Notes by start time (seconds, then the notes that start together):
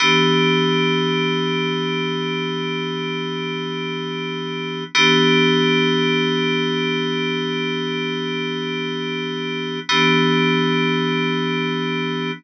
0.00 E3 B3 D4 G4
4.95 E3 B3 D4 G4
9.89 E3 B3 D4 G4